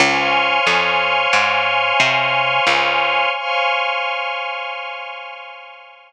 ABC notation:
X:1
M:5/4
L:1/8
Q:1/4=90
K:Dblyd
V:1 name="Pad 5 (bowed)"
[cdfa]10 | [cdfa]10 |]
V:2 name="String Ensemble 1"
[ac'd'f']10 | [ac'd'f']10 |]
V:3 name="Electric Bass (finger)" clef=bass
D,,2 F,,2 A,,2 C,2 D,,2 | z10 |]